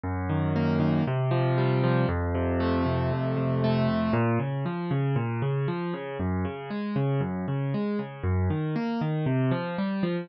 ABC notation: X:1
M:4/4
L:1/8
Q:1/4=117
K:Bbm
V:1 name="Acoustic Grand Piano"
G,, E, B, E, C, F, =G, F, | F,, C, =A, C, F,, C, A, C, | B,, D, F, D, B,, D, F, D, | G,, D, A, D, G,, D, A, D, |
G,, E, B, E, C, F, =G, F, |]